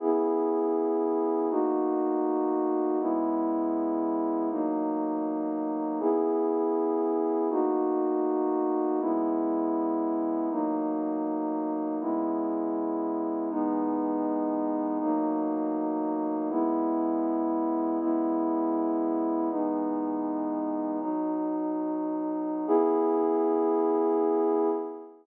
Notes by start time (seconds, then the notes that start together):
0.00 C#3 B3 E4 G#4
1.50 B2 A#3 D#4 F#4
3.00 C#3 G#3 B3 E4
4.50 B2 F#3 A#3 D#4
6.00 C#3 B3 E4 G#4
7.50 B2 A#3 D#4 F#4
9.00 C#3 G#3 B3 E4
10.50 B2 F#3 A#3 D#4
12.00 C#3 G#3 B3 E4
13.50 E3 G#3 B3 D#4
15.00 B2 F#3 A#3 D#4
16.50 C#3 G#3 B3 E4
18.00 C#3 G#3 B3 E4
19.50 E3 G#3 B3 D#4
21.00 B2 F#3 D#4
22.67 C#3 B3 E4 G#4